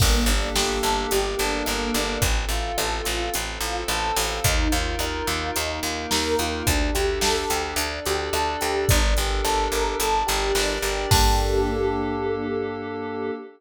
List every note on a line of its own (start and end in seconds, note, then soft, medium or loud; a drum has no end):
0.00 0.25 G1 loud
0.00 0.25 A#3 loud
0.00 1.10 A#3 loud
0.00 1.10 D4 loud
0.00 1.11 G4 loud
0.00 1.10 A4 loud
0.00 kick loud
0.00 crash medium
0.26 0.50 G1 loud
0.26 0.54 D4 medium
0.26 closed hi-hat medium
0.55 0.79 G1 medium
0.55 0.80 G4 medium
0.55 snare loud
0.83 1.07 G1 medium
0.83 1.09 A4 medium
0.83 closed hi-hat medium
1.10 1.35 G1 medium
1.10 2.21 A#3 loud
1.10 2.21 D4 loud
1.10 1.35 G4 loud
1.10 2.21 A4 loud
1.10 2.21 A#4 loud
1.10 closed hi-hat medium
1.39 1.63 G1 medium
1.39 1.65 D4 loud
1.39 closed hi-hat medium
1.66 1.91 G1 medium
1.66 1.92 A#3 medium
1.66 cross-stick medium
1.94 2.18 G1 medium
1.94 2.21 D4 medium
1.94 closed hi-hat medium
2.22 2.45 A1 loud
2.22 2.48 C4 loud
2.22 3.33 C4 medium
2.22 3.33 F4 loud
2.22 3.33 A4 loud
2.22 kick medium
2.22 closed hi-hat medium
2.49 2.72 A1 medium
2.49 2.76 F4 medium
2.49 closed hi-hat medium
2.78 3.02 A1 loud
2.78 3.03 A4 medium
2.78 cross-stick loud
3.04 3.30 A1 medium
3.04 3.29 F4 medium
3.04 closed hi-hat medium
3.34 3.59 A1 medium
3.34 4.44 C4 medium
3.34 3.59 C4 loud
3.34 4.44 A4 loud
3.34 4.44 C5 medium
3.34 closed hi-hat medium
3.61 3.84 A1 medium
3.61 3.87 F4 medium
3.61 closed hi-hat medium
3.88 4.12 A1 loud
3.88 4.15 A4 medium
3.88 cross-stick medium
4.16 4.40 A1 loud
4.16 4.42 F4 medium
4.16 open hi-hat medium
4.44 4.68 D#2 loud
4.44 4.69 D#4 loud
4.44 5.55 D#4 loud
4.44 5.55 F4 loud
4.44 5.55 A#4 loud
4.44 kick loud
4.44 closed hi-hat loud
4.72 4.96 D#2 medium
4.72 4.97 F4 medium
4.72 closed hi-hat medium
4.99 5.22 D#2 medium
4.99 5.25 A#4 medium
4.99 cross-stick loud
5.27 5.51 D#2 medium
5.27 5.52 F4 medium
5.27 closed hi-hat medium
5.56 5.80 D#2 medium
5.56 6.66 A#3 medium
5.56 6.66 D#4 loud
5.56 5.81 D#4 loud
5.56 6.66 A#4 medium
5.56 closed hi-hat medium
5.83 6.06 D#2 medium
5.83 6.09 F4 medium
5.83 closed hi-hat medium
6.11 6.35 D#2 loud
6.11 6.36 A#4 medium
6.11 snare medium
6.39 6.63 D#2 medium
6.39 6.65 F4 medium
6.39 closed hi-hat medium
6.67 6.91 D2 loud
6.67 7.77 D4 medium
6.67 6.92 D4 loud
6.67 7.77 G4 loud
6.67 7.77 A4 loud
6.67 kick medium
6.67 closed hi-hat medium
6.94 7.19 D2 medium
6.94 7.19 G4 medium
6.94 closed hi-hat medium
7.21 7.45 D2 medium
7.21 7.47 A4 loud
7.21 snare loud
7.50 7.74 D2 medium
7.50 7.75 G4 medium
7.50 closed hi-hat medium
7.76 8.00 D2 loud
7.76 8.02 D4 loud
7.76 8.88 D4 medium
7.76 8.88 A4 loud
7.76 8.88 D5 medium
7.76 closed hi-hat medium
8.06 8.30 D2 medium
8.06 8.31 G4 medium
8.06 closed hi-hat medium
8.33 8.57 D2 medium
8.33 8.59 A4 medium
8.33 cross-stick loud
8.61 8.86 D2 medium
8.61 8.86 G4 medium
8.61 closed hi-hat medium
8.89 9.14 G1 loud
8.89 9.99 D4 loud
8.89 9.14 D4 loud
8.89 9.99 G4 medium
8.89 9.99 A4 loud
8.89 9.99 A#4 medium
8.89 kick loud
8.89 closed hi-hat loud
9.17 9.41 G1 medium
9.17 9.43 G4 medium
9.17 closed hi-hat medium
9.44 9.68 G1 medium
9.44 9.69 A4 loud
9.44 cross-stick medium
9.72 9.95 G1 medium
9.72 9.97 A#4 medium
9.72 closed hi-hat medium
10.00 10.23 G1 medium
10.00 11.10 D4 medium
10.00 11.10 G4 medium
10.00 10.25 A4 loud
10.00 11.10 A#4 medium
10.00 11.10 D5 loud
10.00 closed hi-hat medium
10.27 10.52 G1 loud
10.27 10.52 G4 medium
10.27 closed hi-hat medium
10.55 10.79 G1 medium
10.55 10.80 D4 loud
10.55 snare medium
10.82 11.06 G1 medium
10.82 11.08 G4 medium
10.82 closed hi-hat medium
11.11 13.31 G2 loud
11.11 13.30 A#3 loud
11.11 13.31 A#3 loud
11.11 13.30 D4 loud
11.11 13.31 D4 loud
11.11 13.30 G4 loud
11.11 13.31 G4 loud
11.11 13.30 A4 medium
11.11 13.31 A4 loud
11.11 kick loud
11.11 crash loud